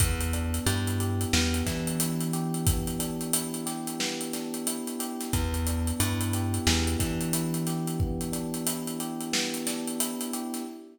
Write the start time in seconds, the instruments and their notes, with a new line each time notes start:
0.00 electric bass (finger) E2, electric piano 1 B3, kick, closed hi-hat
0.21 closed hi-hat
0.33 electric piano 1 D4, closed hi-hat
0.54 closed hi-hat
0.66 electric bass (finger) G2, electric piano 1 E4, closed hi-hat
0.87 closed hi-hat
1.00 electric piano 1 G4, closed hi-hat
1.21 closed hi-hat
1.33 electric bass (finger) E2, electric piano 1 B3, snare
1.54 closed hi-hat
1.66 electric bass (finger) E3, electric piano 1 D4, kick, snare, closed hi-hat
1.87 closed hi-hat
2.00 electric piano 1 E4, closed hi-hat
2.21 closed hi-hat
2.33 electric piano 1 G4, closed hi-hat
2.54 closed hi-hat
2.67 electric piano 1 B3, kick, closed hi-hat
2.87 closed hi-hat
2.99 electric piano 1 D4, closed hi-hat
3.21 closed hi-hat
3.33 electric piano 1 E4, closed hi-hat
3.54 closed hi-hat
3.66 electric piano 1 G4, snare, closed hi-hat
3.87 closed hi-hat
4.00 electric piano 1 B3, snare
4.21 closed hi-hat
4.33 electric piano 1 D4, snare, closed hi-hat
4.54 closed hi-hat
4.67 electric piano 1 E4, closed hi-hat
4.87 closed hi-hat
4.99 electric piano 1 G4, closed hi-hat
5.20 snare, closed hi-hat
5.33 electric bass (finger) E2, electric piano 1 B3, kick, closed hi-hat
5.54 closed hi-hat
5.66 electric piano 1 D4, closed hi-hat
5.87 closed hi-hat
5.99 electric bass (finger) G2, electric piano 1 E4, closed hi-hat
6.21 closed hi-hat
6.33 electric piano 1 G4, closed hi-hat
6.54 closed hi-hat
6.67 electric bass (finger) E2, electric piano 1 B3, snare
6.87 closed hi-hat
6.99 electric bass (finger) E3, electric piano 1 D4, kick, snare, closed hi-hat
7.21 closed hi-hat
7.33 electric piano 1 E4, closed hi-hat
7.54 closed hi-hat
7.67 electric piano 1 G4, snare, closed hi-hat
7.87 closed hi-hat
8.00 electric piano 1 B3, kick
8.21 closed hi-hat
8.32 electric piano 1 D4, closed hi-hat
8.54 closed hi-hat
8.67 electric piano 1 E4, closed hi-hat
8.87 closed hi-hat
9.00 electric piano 1 G4, closed hi-hat
9.21 closed hi-hat
9.33 electric piano 1 B3, snare
9.54 closed hi-hat
9.67 electric piano 1 D4, snare, closed hi-hat
9.87 closed hi-hat
10.00 electric piano 1 E4, closed hi-hat
10.21 closed hi-hat
10.33 electric piano 1 G4, closed hi-hat
10.54 snare, closed hi-hat